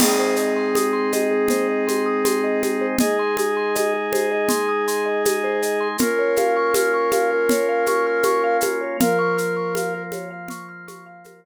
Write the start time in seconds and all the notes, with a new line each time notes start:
0.00 G#3 C4 D#4 G#4, crash, low conga, shaker
0.19 C5
0.36 D#5, shaker
0.56 C6
0.75 D#6, high conga, shaker
0.93 C6
1.12 D#5, high conga, shaker
1.31 G#4
1.48 C5, low conga, shaker
1.68 D#5
1.87 C6, high conga, shaker
2.06 D#6
2.25 C6, high conga, shaker
2.44 D#5
2.62 G#4, high conga, shaker
2.81 C5
2.99 G#3 D#4 G#4 D#5, low conga, shaker
3.19 C6
3.37 D#6, high conga, shaker
3.57 C6
3.75 D#5, high conga, shaker
3.94 G#4
4.13 C5, high conga, shaker
4.32 D#5
4.49 C6, low conga, shaker
4.69 D#6
4.88 C6, shaker
5.06 D#5
5.25 G#4, high conga, shaker
5.44 C5
5.62 D#5, shaker
5.80 C6
5.98 A#3 C#4 F4 A#4, low conga, shaker
6.19 C#5
6.36 F5, high conga, shaker
6.57 C#6
6.74 F6, high conga, shaker
6.94 C#6
7.11 F5, high conga, shaker
7.31 A#4
7.49 C#5, low conga, shaker
7.69 F5
7.86 C#6, high conga, shaker
8.07 F6
8.23 C#6, high conga, shaker
8.44 F5
8.61 A#4, high conga, shaker
8.81 C#5
9.00 F3 A#3 F4 A#4 F5, low conga, shaker
9.19 C#6
9.38 F6, shaker
9.57 C#6
9.75 F5, high conga, shaker
9.94 A#4
10.12 C#5, high conga, shaker
10.31 F5
10.48 C#6, low conga, shaker
10.69 F6
10.88 C#6, high conga, shaker
11.06 F5
11.24 A#4, high conga, shaker
11.44 C#5